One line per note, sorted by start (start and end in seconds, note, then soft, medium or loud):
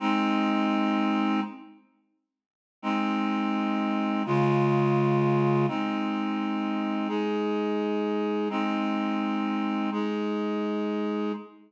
0.00 1.40 G#3 medium
0.00 1.40 C4 loud
0.00 1.40 D#4 medium
2.82 4.23 G#3 medium
2.82 4.23 C4 medium
2.82 4.23 D#4 medium
4.26 5.66 C#3 medium
4.26 5.66 G#3 medium
4.26 5.66 F4 medium
5.68 7.08 G#3 medium
5.68 7.08 C4 medium
5.68 7.08 D#4 medium
7.08 8.49 G#3 medium
7.08 8.49 D#4 medium
7.08 8.49 G#4 medium
8.50 9.90 G#3 medium
8.50 9.90 C4 medium
8.50 9.90 D#4 medium
9.92 11.32 G#3 medium
9.92 11.32 D#4 medium
9.92 11.32 G#4 medium